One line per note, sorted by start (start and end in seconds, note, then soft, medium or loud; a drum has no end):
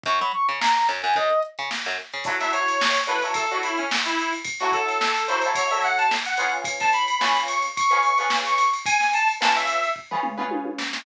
0.03 0.19 F#2 loud
0.03 0.19 C#6 medium
0.03 kick medium
0.03 closed hi-hat medium
0.19 0.32 F#3 medium
0.19 0.32 B5 medium
0.19 closed hi-hat soft
0.31 0.47 C#6 medium
0.31 closed hi-hat medium
0.49 0.60 C#3 medium
0.49 closed hi-hat medium
0.60 0.74 A#5 medium
0.60 snare medium
0.74 0.87 A#5 medium
0.74 closed hi-hat soft
0.89 1.02 F#2 medium
0.89 closed hi-hat soft
1.02 1.15 F#2 medium
1.02 1.14 G#5 medium
1.02 closed hi-hat soft
1.14 1.29 F#2 medium
1.14 1.39 D#5 medium
1.14 kick medium
1.14 closed hi-hat medium
1.30 closed hi-hat medium
1.42 closed hi-hat medium
1.58 1.70 C#3 medium
1.58 closed hi-hat soft
1.71 snare medium
1.85 1.97 F#2 medium
1.85 snare soft
1.85 closed hi-hat soft
1.98 closed hi-hat medium
2.13 2.25 C#3 medium
2.13 closed hi-hat soft
2.24 2.37 F#3 loud
2.24 2.37 E4 medium
2.24 2.37 A4 loud
2.24 2.37 C#5 loud
2.24 kick medium
2.24 crash loud
2.40 2.83 F#3 medium
2.40 2.83 E4 medium
2.40 2.83 A4 medium
2.40 2.83 C#5 medium
2.40 2.52 E5 medium
2.40 snare soft
2.40 ride medium
2.53 3.00 C#5 medium
2.53 ride medium
2.68 ride medium
2.81 snare loud
2.94 snare soft
2.94 ride medium
3.07 3.19 F#3 medium
3.07 3.19 E4 medium
3.07 3.19 A4 medium
3.07 3.22 B4 medium
3.07 3.19 C#5 medium
3.07 ride medium
3.22 3.44 F#3 medium
3.22 3.44 E4 medium
3.22 3.44 A4 medium
3.22 3.44 C#5 medium
3.22 ride medium
3.34 3.49 A4 medium
3.34 kick medium
3.34 ride medium
3.51 3.95 F#3 medium
3.51 3.95 E4 medium
3.51 3.63 F#4 medium
3.51 3.95 A4 loud
3.51 3.95 C#5 medium
3.51 ride medium
3.63 3.77 E4 medium
3.63 ride medium
3.77 3.90 C#4 medium
3.77 ride medium
3.91 snare loud
4.05 4.31 E4 medium
4.05 ride medium
4.19 ride medium
4.33 ride medium
4.44 kick medium
4.44 ride medium
4.60 5.04 F#3 medium
4.60 5.04 E4 medium
4.60 4.72 F#4 medium
4.60 5.04 A4 medium
4.60 5.04 C#5 medium
4.60 snare soft
4.60 ride medium
4.72 5.24 A4 medium
4.72 kick medium
4.72 ride medium
4.88 ride medium
5.01 snare medium
5.16 ride medium
5.28 5.40 F#3 medium
5.28 5.40 E4 medium
5.28 5.40 A4 medium
5.28 5.42 C5 medium
5.28 5.40 C#5 medium
5.28 snare soft
5.28 ride medium
5.42 5.66 A4 medium
5.42 5.66 C#5 medium
5.42 ride medium
5.46 5.66 F#3 medium
5.46 5.66 E4 medium
5.55 5.70 C#5 medium
5.55 kick medium
5.55 ride medium
5.71 6.14 F#3 medium
5.71 6.14 E4 medium
5.71 6.14 A4 medium
5.71 6.14 C#5 medium
5.71 5.83 E5 medium
5.71 ride medium
5.82 5.98 F#5 medium
5.82 ride medium
5.98 6.10 A5 medium
5.98 ride medium
6.11 snare medium
6.25 6.51 F#5 medium
6.25 snare soft
6.25 ride medium
6.37 7.10 C#4 loud
6.37 7.10 F4 loud
6.37 7.10 G#4 loud
6.37 7.10 B4 medium
6.37 ride medium
6.51 ride soft
6.64 kick medium
6.64 ride medium
6.80 6.92 A5 medium
6.80 kick medium
6.80 snare soft
6.80 ride medium
6.93 7.39 B5 medium
6.93 ride medium
7.08 ride medium
7.20 7.65 C#4 loud
7.20 7.65 F4 medium
7.20 7.65 G#4 medium
7.20 7.65 B4 medium
7.20 snare medium
7.37 ride medium
7.48 7.62 C#6 medium
7.48 ride medium
7.62 ride medium
7.76 7.90 C#6 medium
7.76 kick medium
7.76 ride medium
7.90 8.12 C#4 loud
7.90 8.12 F4 medium
7.90 8.12 G#4 medium
7.90 8.12 B4 medium
7.90 8.03 C#6 medium
7.90 ride medium
8.03 8.18 C#6 medium
8.03 ride medium
8.18 8.62 C#4 medium
8.18 8.62 F4 medium
8.18 8.62 G#4 medium
8.18 8.62 B4 loud
8.18 8.30 C#6 medium
8.18 ride medium
8.30 snare medium
8.46 8.70 C#6 medium
8.46 ride medium
8.58 ride medium
8.73 ride medium
8.86 9.11 G#5 medium
8.86 kick medium
8.86 ride loud
9.00 snare soft
9.00 ride medium
9.13 9.28 A5 medium
9.13 ride medium
9.28 ride medium
9.41 9.86 C#4 medium
9.41 9.86 F4 medium
9.41 9.86 G#4 medium
9.41 9.86 B4 medium
9.41 9.55 A5 medium
9.41 snare medium
9.56 9.90 E5 medium
9.56 ride medium
9.67 ride medium
9.83 ride medium
9.96 kick medium
10.11 10.33 C#4 medium
10.11 10.33 F4 medium
10.11 10.33 G#4 medium
10.11 10.33 B4 loud
10.11 floor tom medium
10.23 mid tom medium
10.38 10.81 C#4 medium
10.38 10.81 F4 medium
10.38 10.81 G#4 medium
10.38 10.81 B4 medium
10.38 mid tom medium
10.51 high tom medium
10.65 high tom medium
10.78 snare medium
10.93 snare medium